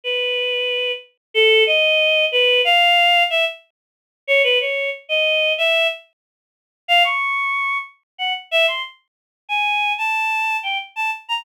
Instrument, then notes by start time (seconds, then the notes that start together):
choir aahs
0.04 B4
1.34 A4
1.67 D#5
2.32 B4
2.65 F5
3.30 E5
4.27 C#5
4.44 B4
4.61 C#5
5.09 D#5
5.58 E5
6.88 F5
7.04 C#6
8.18 F#5
8.51 E5
8.67 C6
9.49 G#5
9.98 A5
10.63 G5
10.96 A5
11.29 A#5